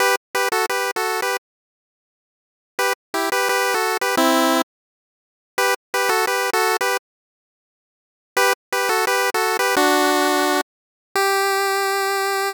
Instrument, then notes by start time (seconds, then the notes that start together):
lead 1 (square)
0.00 G4 B4
0.35 G4 B4
0.52 F#4 A4
0.69 G4 B4
0.96 F#4 A4
1.22 G4 B4
2.79 G4 B4
3.14 E4 G4
3.32 G4 B4
3.49 G4 B4
3.74 F#4 A4
4.01 G4 B4
4.17 C4 E4
5.58 G4 B4
5.94 G4 B4
6.09 F#4 A4
6.27 G4 B4
6.53 F#4 A4
6.81 G4 B4
8.37 G4 B4
8.72 G4 B4
8.89 F#4 A4
9.07 G4 B4
9.34 F#4 A4
9.59 G4 B4
9.77 D4 F#4
11.15 G4